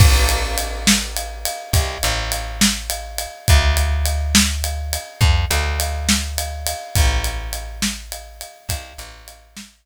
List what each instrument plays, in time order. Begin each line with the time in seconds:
0.00 electric bass (finger) A1, kick, crash
0.29 ride
0.58 ride
0.87 snare
1.17 ride
1.45 ride
1.73 electric bass (finger) C2, kick, ride
2.03 electric bass (finger) A1, ride
2.32 ride
2.61 snare
2.90 ride
3.18 ride
3.48 electric bass (finger) D2, kick, ride
3.77 ride
4.06 ride
4.35 snare
4.64 ride
4.93 ride
5.21 electric bass (finger) F2, kick
5.50 electric bass (finger) D2, ride
5.80 ride
6.09 snare
6.38 ride
6.67 ride
6.95 electric bass (finger) A1, kick, ride
7.24 ride
7.53 ride
7.82 snare
8.12 ride
8.41 ride
8.69 electric bass (finger) C2, kick, ride
8.98 electric bass (finger) A1, ride
9.28 ride
9.57 snare